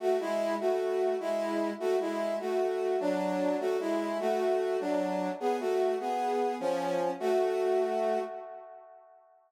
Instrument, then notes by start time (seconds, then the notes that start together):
brass section
0.00 A3 F#4
0.20 G#3 E4
0.60 A3 F#4
1.20 G#3 E4
1.80 A3 F#4
2.00 G#3 E4
2.40 A3 F#4
3.00 F#3 D4
3.60 A3 F#4
3.80 G#3 E4
4.20 A3 F#4
4.80 F#3 D4
5.40 B3 G#4
5.60 A3 F#4
6.00 B3 G#4
6.60 F3 C#4
7.20 A3 F#4